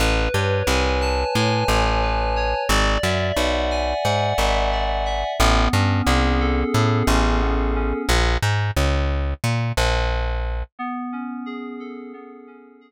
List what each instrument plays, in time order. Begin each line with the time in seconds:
0.00 electric bass (finger) A1, electric piano 2 B4
0.34 electric bass (finger) G2, electric piano 2 C#5
0.67 electric bass (finger) C2, electric piano 2 G#5
1.01 electric piano 2 A5
1.35 electric bass (finger) A2, electric piano 2 G#5
1.68 electric bass (finger) A1, electric piano 2 C#5
2.02 electric piano 2 B4
2.36 electric piano 2 C#5
2.69 electric bass (finger) G#1, electric piano 2 D5
3.03 electric bass (finger) F#2, electric piano 2 E5
3.37 electric bass (finger) B1, electric piano 2 F#5
3.71 electric piano 2 G#5
4.04 electric bass (finger) G#2, electric piano 2 F#5
4.38 electric bass (finger) G#1, electric piano 2 E5
4.72 electric piano 2 D5
5.05 electric piano 2 E5
5.39 electric bass (finger) A1, electric piano 2 B3
5.73 electric bass (finger) G2, electric piano 2 C#4
6.07 electric bass (finger) C2, electric piano 2 G#4
6.40 electric piano 2 A4
6.74 electric bass (finger) A2, electric piano 2 G#4
7.07 electric bass (finger) A1, electric piano 2 C#4
7.42 electric piano 2 B3
7.75 electric piano 2 C#4
8.09 electric bass (finger) A#1
8.42 electric bass (finger) G#2
8.77 electric bass (finger) C#2
9.44 electric bass (finger) A#2
9.77 electric bass (finger) A#1
10.79 electric piano 2 B3
11.12 electric piano 2 C#4
11.46 electric piano 2 G#4
11.80 electric piano 2 A4
12.13 electric piano 2 B3
12.47 electric piano 2 C#4
12.81 electric piano 2 G#4